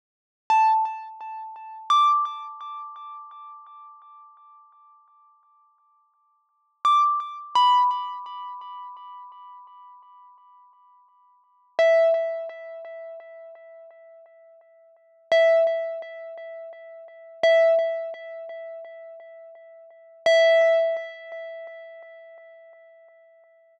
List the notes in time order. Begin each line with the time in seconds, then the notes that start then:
0.50 A5
1.90 D6
6.85 D6
7.55 B5
11.79 E5
15.32 E5
17.43 E5
20.26 E5